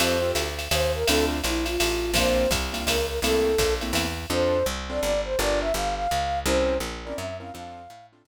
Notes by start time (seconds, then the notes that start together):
0.00 F2 C4 F4 G4 A4 C5, ride
0.22 C4 F4 G4 A4
0.35 D2, hi-hat pedal, ride
0.59 ride
0.71 D#2 C5, ride
0.94 A#4
1.07 D2 C4 D4 E4 F4 A4, ride
1.44 A#1 E4, hi-hat pedal, ride
1.66 F4, ride
1.80 A1, ride
2.14 A#1 A#3 C4 D4 F4 C5, kick, ride
2.51 C2, kick, hi-hat pedal, ride
2.73 A#3 C4 D4 F4, ride
2.87 C#2 A#4, ride
3.08 A#4
3.22 C2 A3 A#3 C4 E4 A4, ride
3.58 A#1, kick, hi-hat pedal, ride
3.81 A3 A#3 C4 E4, ride
3.93 E2, ride
4.30 F2 C4 D4 F4 A4 C5
4.66 C2
4.90 C4 D4 F4 A4 D5
5.02 G1 D5
5.25 C5
5.39 G1 D4 F4 G4 A#4 D5
5.61 E5
5.74 G1 F5
5.95 F5
6.11 C#2
6.46 C2 C4 C#4 E4 A#4 C5
6.80 A#1
7.05 C4 C#4 E4 A#4 D5
7.16 F#2 E5
7.40 C4 C#4 E4 A#4 F5
7.53 F2 C4 D4 F4 A4 F5
7.90 A2
8.13 C4 D4 F4 A4
8.25 C3